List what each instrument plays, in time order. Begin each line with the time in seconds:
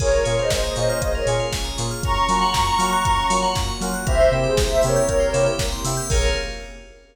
0.00 synth bass 2 A#1, electric piano 2 A#3 C#4 F4 G#4, pad 2 (warm) A#3 C#4 F4 G#4, tubular bells G#4, ocarina A#4 C#5, kick, crash
0.11 tubular bells A#4
0.24 synth bass 2 A#2, electric piano 2 A#3 C#4 F4 G#4, ocarina A#4 C#5, tubular bells C#5, open hi-hat
0.38 ocarina C5 D#5, tubular bells F5
0.50 synth bass 2 A#1, ocarina C5 D#5, tubular bells G#5, kick, snare
0.64 ocarina C5 D#5, tubular bells A#5
0.75 synth bass 2 A#2, electric piano 2 A#3 C#4 F4 G#4, ocarina C5 D#5, tubular bells C#6, open hi-hat
0.89 tubular bells F6
1.01 synth bass 2 A#1, tubular bells G#4, ocarina C5 D#5, kick, closed hi-hat
1.15 tubular bells A#4, ocarina A#4 C#5
1.26 synth bass 2 A#2, electric piano 2 A#3 C#4 F4 G#4, tubular bells C#5, open hi-hat
1.40 tubular bells F5
1.52 synth bass 2 A#1, tubular bells G#5, kick, snare
1.65 tubular bells A#5
1.78 synth bass 2 A#2, electric piano 2 A#3 C#4 F4 G#4, tubular bells C#6, snare, open hi-hat
1.91 tubular bells F6
2.03 synth bass 2 F#2, pad 2 (warm) A#3 C#4 F4 F#4, electric piano 2 A#3 C#4 F4 F#4, tubular bells A#4, ocarina A#5 C#6, kick, closed hi-hat
2.17 tubular bells C#5
2.29 synth bass 2 F#3, electric piano 2 A#3 C#4 F4 F#4, tubular bells F5, open hi-hat
2.42 tubular bells F#5
2.54 synth bass 2 F#2, tubular bells A#5, kick, snare
2.67 tubular bells C#6
2.78 synth bass 2 F#3, electric piano 2 A#3 C#4 F4 F#4, tubular bells F6, open hi-hat
2.92 tubular bells F#6
3.05 synth bass 2 F#2, tubular bells A#4, kick, closed hi-hat
3.17 tubular bells C#5
3.30 synth bass 2 F#3, electric piano 2 A#3 C#4 F4 F#4, tubular bells F5, open hi-hat
3.43 tubular bells F#5
3.55 synth bass 2 F#2, tubular bells A#5, kick, snare
3.68 tubular bells C#6
3.81 synth bass 2 F#3, electric piano 2 A#3 C#4 F4 F#4, tubular bells F6, snare, open hi-hat
3.94 tubular bells F#6
4.06 synth bass 2 C2, pad 2 (warm) A#3 C4 E4 G4, electric piano 2 A#3 C4 E4 G4, tubular bells A#4, ocarina C5 E5, kick, closed hi-hat
4.20 tubular bells C5
4.32 synth bass 2 C3, electric piano 2 A#3 C4 E4 G4, tubular bells E5
4.43 ocarina G#4 C5, tubular bells G5
4.57 synth bass 2 C2, tubular bells A#5, kick, snare
4.69 ocarina C5 E5, tubular bells C6
4.81 synth bass 2 C3, electric piano 2 A#3 C4 E4 G4, ocarina A#4 C#5, tubular bells E6, open hi-hat
4.96 tubular bells G6
5.09 synth bass 2 C2, tubular bells A#4, kick, closed hi-hat
5.20 tubular bells C5
5.33 synth bass 2 C3, electric piano 2 A#3 C4 E4 G4, tubular bells E5, open hi-hat
5.46 tubular bells G5
5.59 synth bass 2 C2, tubular bells A#5, kick, snare
5.72 tubular bells C6
5.84 synth bass 2 C3, electric piano 2 A#3 C4 E4 G4, tubular bells E6, snare, open hi-hat
5.97 tubular bells G6
6.09 synth bass 2 A#1, pad 2 (warm) A#3 C#4 F4 G#4, electric piano 2 A#3 C#4 F4 G#4, tubular bells G#4 A#4 C#5 F5, ocarina A#4, kick, crash